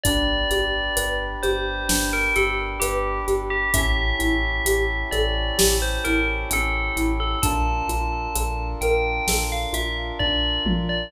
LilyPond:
<<
  \new Staff \with { instrumentName = "Tubular Bells" } { \time 4/4 \key d \minor \tempo 4 = 65 d''4. c''8. bes'16 a'16 r16 g'8 r16 g'16 | e''4. d''8. c''16 bes'16 r16 a'8 r16 a'16 | a''4. g''8. f''16 e''16 r16 d''8 r16 d''16 | }
  \new Staff \with { instrumentName = "Xylophone" } { \time 4/4 \key d \minor d'8 g'8 b'8 g'8 d'8 g'8 b'8 g'8 | cis'8 e'8 g'8 a'8 g'8 e'8 cis'8 e'8 | d'8 f'8 a'8 bes'8 a'8 f'8 d'8 f'8 | }
  \new Staff \with { instrumentName = "Synth Bass 2" } { \clef bass \time 4/4 \key d \minor g,,8 g,,8 g,,8 g,,8 g,,8 g,,8 g,,8 g,,8 | a,,8 a,,8 a,,8 a,,8 a,,8 a,,8 a,,8 a,,8 | bes,,8 bes,,8 bes,,8 bes,,8 bes,,8 bes,,8 bes,,8 bes,,8 | }
  \new Staff \with { instrumentName = "Brass Section" } { \time 4/4 \key d \minor <d' g' b'>1 | <cis' e' g' a'>1 | <d' f' a' bes'>1 | }
  \new DrumStaff \with { instrumentName = "Drums" } \drummode { \time 4/4 <hh bd>8 hh8 hh8 hh8 sn8 hh8 hh8 hh8 | <hh bd>8 hh8 hh8 hh8 sn8 hh8 hh8 hh8 | <hh bd>8 hh8 hh8 hh8 sn8 hh8 bd8 toml8 | }
>>